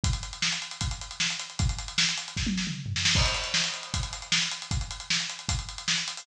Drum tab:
CC |----------------|----------------|x---------------|----------------|
HH |xxxx-xxxxxxx-xxx|xxxx-xxx--------|-xxx-xxxxxxx-xxx|xxxx-xxxxxxx-xxo|
SD |----o-------o---|----o---o-o---oo|----o-------o---|----o-------o---|
T1 |----------------|---------o------|----------------|----------------|
T2 |----------------|-----------o----|----------------|----------------|
FT |----------------|-------------o--|----------------|----------------|
BD |o-------o-------|o-------o-------|o-------o-------|o-------o-------|